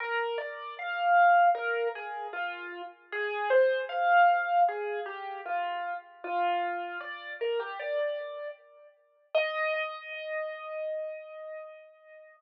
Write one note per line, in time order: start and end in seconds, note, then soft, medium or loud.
0.00 0.38 A#4 medium
0.38 0.74 D5 medium
0.79 1.46 F5 medium
1.55 1.88 A#4 medium
1.95 2.27 G#4 medium
2.33 2.81 F4 medium
3.12 3.49 G#4 medium
3.50 3.81 C5 medium
3.89 4.61 F5 medium
4.69 5.00 G#4 medium
5.06 5.41 G4 medium
5.46 5.94 F4 medium
6.24 6.98 F4 medium
7.00 7.33 D5 medium
7.41 7.59 A#4 medium
7.60 7.78 G4 medium
7.80 8.48 D5 medium
9.35 12.37 D#5 loud